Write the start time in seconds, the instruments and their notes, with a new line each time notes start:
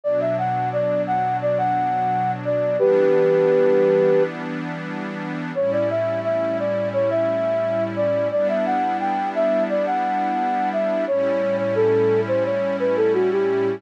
0.04 pad 2 (warm) B2 F#3 D4, flute D5
0.21 flute E5
0.38 flute F#5
0.73 flute D5
1.07 flute F#5
1.42 flute D5
1.58 flute F#5
2.45 flute D5
2.79 pad 2 (warm) E3 G3 B3 D4, flute G4 B4
5.55 pad 2 (warm) A2 G3 C#4 E4, flute C#5
5.72 flute D5
5.90 flute E5
6.24 flute E5
6.59 flute D5
6.93 flute C#5
7.10 flute E5
7.96 flute D5
8.31 pad 2 (warm) G3 B3 D4 E4, flute D5
8.49 flute E5
8.66 flute F#5
9.00 flute G5
9.35 flute E5
9.70 flute D5
9.86 flute F#5
10.73 flute E5
11.07 pad 2 (warm) A2 G3 C#4 E4, flute C#5
11.58 flute C#5
11.75 flute A4
12.28 flute C5
12.45 flute C#5
12.79 flute B4
12.97 flute A4
13.14 flute F#4
13.31 flute G4